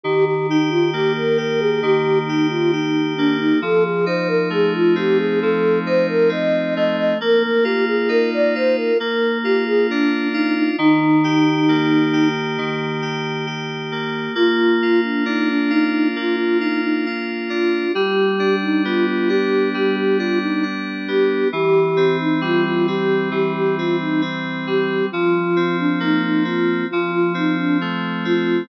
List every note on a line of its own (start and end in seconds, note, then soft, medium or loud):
0.03 1.82 D#3 loud
0.03 0.25 G4 medium
0.25 0.47 G4 medium
0.49 0.70 D#4 medium
0.49 1.37 G4 medium
0.69 0.91 F4 medium
0.91 3.18 A#3 medium
0.91 1.13 G4 medium
1.17 1.38 A#4 medium
1.37 2.28 G4 medium
1.37 1.60 A#4 medium
1.60 1.81 G#4 medium
1.82 3.53 D#3 loud
1.82 2.19 G4 medium
2.26 2.47 D#4 medium
2.26 2.72 G4 medium
2.50 2.71 F4 medium
2.72 3.13 D#4 medium
2.72 3.58 G4 medium
3.16 3.61 A#3 medium
3.16 3.37 D4 medium
3.38 3.60 D#4 medium
3.62 5.42 F3 loud
3.62 3.84 A4 medium
3.84 4.05 G#4 medium
4.06 5.86 D#4 medium
4.06 4.28 C5 medium
4.27 4.49 A#4 medium
4.50 6.76 A3 medium
4.50 4.73 G#4 medium
4.74 4.95 F4 medium
4.95 6.28 C4 medium
4.95 5.18 G4 medium
5.18 5.40 G#4 medium
5.41 7.12 F3 medium
5.41 5.79 A4 medium
5.86 7.14 D#4 medium
5.86 6.07 C5 medium
6.08 6.30 A#4 medium
6.29 7.14 C4 medium
6.29 6.74 D#5 medium
6.76 7.19 A3 medium
6.76 6.96 D#5 medium
6.97 7.18 D#5 medium
7.21 8.91 A#3 loud
7.21 7.43 A#4 medium
7.43 7.64 A#4 medium
7.63 8.54 F4 medium
7.63 7.85 G4 medium
7.87 8.09 G#4 medium
8.09 8.94 D#4 medium
8.09 8.30 A#4 medium
8.33 8.54 D5 medium
8.55 8.98 F4 medium
8.55 8.76 C5 medium
8.76 8.98 A#4 medium
9.00 10.70 A#3 loud
9.00 9.38 A#4 medium
9.43 10.33 F4 medium
9.43 9.64 G4 medium
9.66 9.87 G#4 medium
9.88 10.28 D4 medium
9.88 10.76 D4 medium
10.33 10.54 D#4 medium
10.33 10.76 F4 medium
10.55 10.76 D#4 medium
10.78 12.57 D#3 loud
10.78 12.28 D#4 medium
11.24 12.12 G4 loud
11.68 13.91 A#3 medium
12.13 13.01 G4 medium
12.58 14.28 D#3 loud
13.02 13.46 G4 medium
13.46 14.32 G4 medium
13.92 14.34 A#3 medium
14.35 16.15 A#3 loud
14.35 15.01 F4 medium
14.82 15.70 F4 medium
15.03 15.24 D4 medium
15.26 17.49 D4 medium
15.26 15.48 D#4 medium
15.50 15.71 D4 medium
15.70 16.08 D#4 medium
15.70 16.60 F4 medium
16.16 17.86 A#3 medium
16.16 16.36 F4 medium
16.36 16.58 F4 medium
16.60 16.81 D#4 medium
16.60 17.05 F4 medium
16.84 17.05 D#4 medium
17.06 17.91 F4 medium
17.49 17.92 D4 medium
17.49 17.92 F4 medium
17.93 19.74 G3 loud
17.93 18.56 G4 medium
18.39 19.29 D4 medium
18.62 18.83 D#4 medium
18.84 21.07 B3 medium
18.84 19.06 F4 medium
19.08 19.29 F4 medium
19.28 20.19 D4 medium
19.28 19.69 G4 medium
19.74 21.44 G3 medium
19.74 19.96 G4 medium
19.96 20.17 G4 medium
20.17 20.62 D4 medium
20.17 20.39 F4 medium
20.42 20.64 D#4 medium
20.63 21.48 D4 medium
21.08 21.50 B3 medium
21.08 21.48 G4 medium
21.52 23.31 E3 loud
21.52 22.17 G4 medium
21.97 22.87 C4 loud
22.20 22.41 D#4 medium
22.41 24.66 G3 loud
22.41 22.64 F4 medium
22.65 22.86 F4 medium
22.87 23.78 C4 medium
22.87 23.29 G4 medium
23.31 25.01 E3 medium
23.31 23.53 G4 medium
23.54 23.76 G4 medium
23.76 24.21 C4 medium
23.76 23.97 F4 medium
24.01 24.22 D#4 medium
24.21 25.07 C4 loud
24.67 25.10 G3 medium
24.67 25.06 G4 medium
25.11 26.83 F3 loud
25.11 25.76 F4 medium
25.56 26.44 C4 medium
25.79 26.00 D4 medium
26.00 26.85 A#3 medium
26.00 26.22 D#4 medium
26.23 26.44 D#4 medium
26.45 26.87 C4 medium
26.45 26.85 F4 medium
26.90 28.62 F3 loud
26.90 27.11 F4 medium
27.11 27.33 F4 medium
27.34 28.24 C4 medium
27.34 27.57 D#4 medium
27.57 27.78 D4 medium
27.81 28.66 A3 medium
28.25 28.67 C4 medium
28.25 28.63 F4 medium